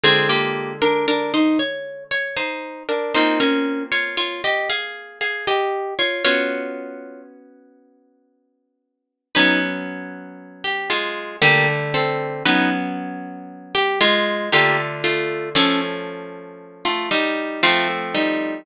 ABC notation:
X:1
M:3/4
L:1/16
Q:1/4=58
K:Ebmix
V:1 name="Orchestral Harp"
[CA] [B,G]2 [=DB] [DB] [Ec] _d2 d [Ec]2 [=DB] | [Ec] [DB]2 [Fd] [Fd] [Ge] [Af]2 [Af] [Ge]2 [Fd] | [Fd]4 z8 | [K:Bbmix] [E_c] z4 G [A,F]2 [B,G] z [=C=A]2 |
[E_c] z4 G [A,F]2 [B,G] z [=A,F]2 | [^C=A] z4 [=A,F] [G,E]2 [A,F] z [G,E]2 |]
V:2 name="Orchestral Harp"
[=D,A,F]12 | [B,CF]12 | [_CD_G]12 | [K:Bbmix] [_G,_C_D]8 [=D,=G,=A,]4 |
[_G,_C_D]8 [=D,=A,F]4 | [F,=A,^C]8 [F,A,=C]4 |]